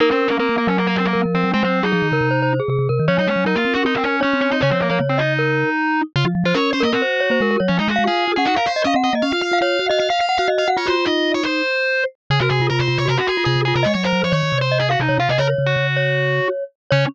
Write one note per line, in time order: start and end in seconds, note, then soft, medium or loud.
0.00 0.09 A#3 medium
0.00 0.09 D#4 medium
0.00 0.36 A#4 loud
0.10 0.29 C4 medium
0.10 0.28 C#4 medium
0.28 0.37 A#3 medium
0.28 0.39 C#4 medium
0.39 0.56 A#3 medium
0.39 0.48 C4 medium
0.39 1.12 A#4 medium
0.49 0.58 A#3 medium
0.58 0.67 A#3 medium
0.67 1.14 F#3 medium
0.67 0.77 C#4 medium
0.78 0.87 A#3 medium
0.87 0.96 A#3 medium
0.96 1.05 C4 medium
1.06 1.21 A#3 medium
1.13 1.25 F#3 medium
1.13 1.50 A#4 medium
1.25 1.34 F3 medium
1.34 1.44 F3 medium
1.34 1.51 C4 medium
1.44 1.53 F#3 medium
1.54 1.63 G#3 loud
1.54 1.63 C4 medium
1.63 1.82 F#3 medium
1.63 1.83 C4 medium
1.63 1.79 C5 medium
1.83 1.93 F#3 medium
1.83 2.53 D#4 medium
1.83 1.92 G#4 medium
1.92 2.02 F3 medium
1.92 2.08 G#4 medium
2.02 2.11 D#3 medium
2.12 2.21 C#3 medium
2.12 2.29 A#4 medium
2.21 2.60 C3 medium
2.31 2.40 C5 medium
2.42 2.61 C5 medium
2.60 2.69 G#4 medium
2.68 2.77 C3 medium
2.68 2.88 G#4 medium
2.79 2.88 C3 medium
2.89 2.99 C3 medium
2.89 3.05 A#4 medium
2.99 3.09 D#3 medium
3.08 3.18 F3 medium
3.08 3.17 C#4 medium
3.08 3.44 C#5 loud
3.18 3.27 F#3 medium
3.18 3.28 D#4 medium
3.27 3.36 G#3 medium
3.27 3.44 C#4 medium
3.36 3.45 F#3 medium
3.45 3.54 F#3 medium
3.45 3.55 D#4 medium
3.45 4.16 A#4 medium
3.56 3.65 A#3 medium
3.56 3.74 F4 medium
3.65 3.74 C4 medium
3.74 3.85 C#4 medium
3.74 3.83 F#4 medium
3.85 3.94 C4 medium
3.85 3.95 D#4 medium
3.95 4.04 C4 medium
4.04 4.20 C#4 medium
4.21 4.41 C#4 medium
4.21 4.34 C#4 medium
4.21 4.56 C#5 medium
4.33 4.50 C4 medium
4.41 4.50 C#4 medium
4.51 4.61 C4 medium
4.51 4.60 D#4 medium
4.61 4.72 C#3 medium
4.61 4.70 C#4 medium
4.61 4.88 C#5 loud
4.71 4.90 F3 medium
4.71 4.80 C4 medium
4.80 4.89 A#3 medium
4.90 5.00 F3 medium
4.90 4.99 A#3 medium
4.90 5.17 C#5 medium
5.00 5.64 C#3 medium
5.09 5.19 C4 medium
5.18 6.01 D#4 medium
5.18 5.33 D#5 medium
5.39 5.70 A#4 medium
6.16 6.25 C#3 medium
6.16 6.25 F4 medium
6.25 6.34 F3 medium
6.35 6.44 F3 medium
6.44 6.53 F3 medium
6.44 6.54 F4 medium
6.44 6.55 C5 medium
6.54 6.72 C#4 medium
6.54 6.71 A#4 medium
6.54 6.70 C#5 medium
6.73 6.83 C#4 medium
6.73 6.82 C5 medium
6.80 6.92 A#3 medium
6.80 6.90 A#4 loud
6.80 6.92 D#5 medium
6.93 7.02 C4 medium
6.93 7.56 F#4 medium
6.93 7.02 A#4 medium
7.02 7.21 C5 medium
7.20 7.30 C#5 medium
7.30 7.39 A#3 medium
7.30 7.40 C5 loud
7.41 7.57 G#3 medium
7.41 7.50 A#4 medium
7.51 7.60 A#4 loud
7.60 7.70 F#3 medium
7.60 7.69 C#5 medium
7.68 7.79 F3 loud
7.68 7.77 C#4 medium
7.79 7.87 G#3 medium
7.79 7.88 D#4 medium
7.88 7.97 G#3 medium
7.88 8.04 F#4 medium
7.96 8.08 G#3 medium
7.96 8.05 F5 medium
8.06 8.26 F4 medium
8.06 8.32 G#4 medium
8.06 8.24 F5 medium
8.28 8.37 F4 medium
8.36 8.47 C#4 medium
8.36 8.45 G#4 medium
8.36 8.47 F#5 medium
8.45 8.56 D#4 medium
8.45 8.54 F#4 medium
8.45 8.56 F#5 medium
8.56 8.66 A#4 medium
8.56 8.72 F5 medium
8.66 8.82 C5 medium
8.76 8.85 D#5 medium
8.84 8.94 C#4 medium
8.84 8.93 D#5 medium
8.84 8.96 F5 medium
8.94 9.10 C4 medium
8.94 9.04 F#5 medium
9.04 9.13 D#5 medium
9.04 9.14 F#5 medium
9.13 9.22 A#3 medium
9.13 9.24 D#5 medium
9.22 9.32 C#4 medium
9.22 9.31 F5 medium
9.32 9.42 F4 medium
9.32 9.41 F5 medium
9.42 9.51 F4 medium
9.42 9.58 F5 medium
9.52 9.61 F4 medium
9.52 9.62 F5 medium
9.61 9.78 F4 medium
9.61 9.80 C#5 medium
9.61 9.86 F5 medium
9.79 9.89 F#4 medium
9.89 9.99 F#4 medium
9.89 9.98 D#5 loud
9.89 9.99 F5 medium
9.99 10.09 F#4 medium
9.99 10.08 D#5 medium
9.99 10.09 F5 medium
10.10 10.19 F5 medium
10.10 10.26 F5 medium
10.20 10.37 F5 medium
10.29 10.38 F#5 medium
10.38 10.48 F#4 medium
10.38 10.47 F5 medium
10.48 10.64 F#4 medium
10.48 10.57 D#5 medium
10.58 10.67 D#5 medium
10.58 10.68 F5 medium
10.68 10.77 F#4 medium
10.68 10.77 F#5 loud
10.77 11.41 F4 loud
10.77 10.86 F4 loud
10.77 10.87 C#5 medium
10.86 10.95 F#4 medium
10.86 11.05 C5 medium
11.06 11.62 D#4 medium
11.06 11.32 D#5 medium
11.34 11.44 C#5 medium
11.44 12.04 C5 medium
12.30 12.39 C#3 medium
12.30 12.40 G#4 medium
12.40 12.50 C3 medium
12.40 12.60 F#4 medium
12.40 12.49 A#4 medium
12.50 12.59 C3 medium
12.50 12.67 G#4 medium
12.60 12.69 C3 medium
12.60 12.70 F4 medium
12.70 12.79 C3 medium
12.70 12.87 F4 medium
12.70 12.79 A#4 medium
12.79 12.88 C3 medium
12.79 12.98 C5 medium
12.88 12.98 C3 medium
12.88 13.04 F4 medium
12.98 13.08 C3 medium
12.98 13.07 C#5 medium
13.06 13.17 C3 medium
13.06 13.15 F#4 medium
13.06 13.18 A#4 medium
13.18 13.27 F#4 medium
13.18 13.37 F#4 medium
13.27 13.44 G#4 medium
13.37 13.46 F4 medium
13.45 13.55 C3 medium
13.45 13.64 F4 medium
13.45 13.61 G#4 medium
13.56 13.73 C3 medium
13.65 13.83 F4 medium
13.65 13.74 G#4 medium
13.76 13.85 C3 medium
13.76 13.85 A#4 medium
13.83 13.95 G#3 medium
13.83 13.94 C#5 medium
13.83 13.92 D#5 loud
13.94 14.12 F#3 medium
13.94 14.03 C#5 medium
14.04 14.22 A#4 medium
14.04 14.32 C5 medium
14.13 14.22 F#3 medium
14.23 14.33 F3 medium
14.23 14.33 C#5 medium
14.32 14.42 D#3 medium
14.32 14.63 C#5 medium
14.32 14.58 C#5 medium
14.43 14.52 D#3 medium
14.52 14.96 C3 medium
14.61 14.78 C5 medium
14.72 14.87 D#5 medium
14.80 14.89 G#4 medium
14.90 15.00 F#4 medium
14.90 14.99 F5 medium
15.00 15.09 C3 medium
15.00 15.17 D#4 medium
15.09 15.18 C3 medium
15.09 15.18 C#5 medium
15.18 15.28 C3 medium
15.18 15.29 F4 medium
15.18 15.29 F5 medium
15.29 15.38 C3 medium
15.29 15.38 G#4 medium
15.29 15.39 D#5 medium
15.38 15.54 C#3 medium
15.38 15.47 A#4 medium
15.38 15.87 C#5 loud
15.58 15.76 C#3 medium
15.66 16.48 F#4 medium
15.77 16.40 C#3 medium
15.96 16.64 C#5 medium
16.91 17.05 C#3 loud
16.91 17.05 C#4 loud
16.91 17.04 C#5 loud